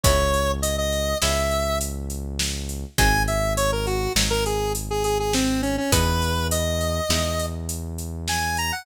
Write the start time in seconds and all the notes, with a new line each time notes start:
0.04 C#2 G#3 B3 C#4 E4 C#5, kick, closed hi-hat
0.34 closed hi-hat
0.62 D#5, closed hi-hat
0.78 D#5
0.93 closed hi-hat
1.22 C#2 G#3 B3 C#4 E4 E5, snare
1.51 closed hi-hat
1.81 closed hi-hat
2.10 closed hi-hat
2.39 snare
2.69 closed hi-hat
2.98 G#1 F#3 G#3 C4 D#4 G#5, kick, closed hi-hat
3.28 E5, closed hi-hat
3.57 C#5, closed hi-hat
3.72 A#4
3.87 F#4, closed hi-hat
4.16 G#1 F#3 G#3 C4 D#4, snare
4.30 A#4
4.46 G#4, closed hi-hat
4.75 closed hi-hat
4.91 G#4
5.04 G#4, closed hi-hat
5.20 G#4
5.33 C4, snare
5.62 C#4, closed hi-hat
5.78 C#4
5.92 E2 G#3 B3 D#4 E4 B4, kick, closed hi-hat
6.22 closed hi-hat
6.51 D#5, closed hi-hat
6.81 closed hi-hat
7.09 E2 G#3 B3 D#4 E4, snare
7.39 closed hi-hat
7.69 closed hi-hat
7.98 closed hi-hat
8.28 G#5, snare
8.57 A#5, closed hi-hat
8.72 F#5